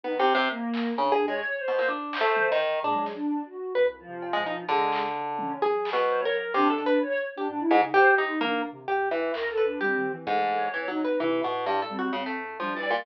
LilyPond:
<<
  \new Staff \with { instrumentName = "Orchestral Harp" } { \time 2/4 \tempo 4 = 129 \tuplet 3/2 { b8 c8 c8 } r4 | \tuplet 3/2 { cis8 gis'8 gis8 } r8 b,16 ais,16 | \tuplet 3/2 { d'4 a4 dis4 } | d'8 r4. |
b'16 r4 gis16 dis'16 r16 | d2 | \tuplet 3/2 { gis'4 b,4 ais'4 } | \tuplet 3/2 { c8 a'8 b'8 } r8. g'16 |
r8 gis,16 r16 g'8 dis'8 | ais8 r8 g'8 e8 | r8 b'8 g'8. r16 | gis,4 \tuplet 3/2 { e8 fis8 b'8 } |
e8 b,8 \tuplet 3/2 { g,8 a'8 fis'8 } | cis16 a8. \tuplet 3/2 { f8 e8 ais,8 } | }
  \new Staff \with { instrumentName = "Choir Aahs" } { \time 2/4 dis16 r8. ais4 | \tuplet 3/2 { d'4 cis''4 c''4 } | r8 c''4 r8 | \tuplet 3/2 { gis4 d'4 fis'4 } |
r8 f4. | gis8. r8. cis'8 | r4 c''16 cis''16 ais'8 | d'4 cis''8 r16 d'16 |
d'16 e'16 r16 dis'16 \tuplet 3/2 { c''8 g'8 dis'8 } | d'8 r4. | \tuplet 3/2 { ais'8 a'8 d'8 } c'8. r16 | \tuplet 3/2 { a4 cis''4 dis'4 } |
r4. c'8 | c'8. r16 \tuplet 3/2 { d'8 d''8 d''8 } | }
  \new Staff \with { instrumentName = "Ocarina" } { \clef bass \time 2/4 r2 | r8 gis,8 r4 | r2 | ais,16 fis8 r4 r16 |
\tuplet 3/2 { c,4 c4 b,4 } | cis2 | fis2 | d8 r4. |
\tuplet 3/2 { gis,8 e,8 cis8 } gis,16 r8. | \tuplet 3/2 { dis,8 c,8 c8 } gis,4 | d,4 \tuplet 3/2 { g8 dis8 e8 } | e4 f,4 |
c8 a,4 g8 | e,4 g4 | }
  \new DrumStaff \with { instrumentName = "Drums" } \drummode { \time 2/4 r4 r8 hc8 | r4 r4 | r8 hc8 tommh4 | tomfh8 sn8 r4 |
r4 cb4 | r8 hc8 r8 tommh8 | tomfh8 hc8 r4 | r8 hh8 r4 |
r4 r4 | tommh4 r4 | hc4 r4 | bd4 r4 |
r8 bd8 r4 | r4 r8 cb8 | }
>>